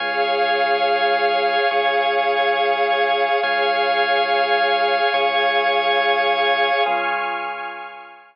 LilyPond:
<<
  \new Staff \with { instrumentName = "Drawbar Organ" } { \time 6/8 \key des \major \tempo 4. = 70 <des'' f'' aes''>2. | <des'' aes'' des'''>2. | <des'' f'' aes''>2. | <des'' aes'' des'''>2. |
<des' f' aes'>2. | }
  \new Staff \with { instrumentName = "Pad 2 (warm)" } { \time 6/8 \key des \major <aes' des'' f''>2.~ | <aes' des'' f''>2. | <aes' des'' f''>2.~ | <aes' des'' f''>2. |
<aes'' des''' f'''>2. | }
  \new Staff \with { instrumentName = "Synth Bass 2" } { \clef bass \time 6/8 \key des \major des,2. | des,2. | des,2. | des,2. |
des,2. | }
>>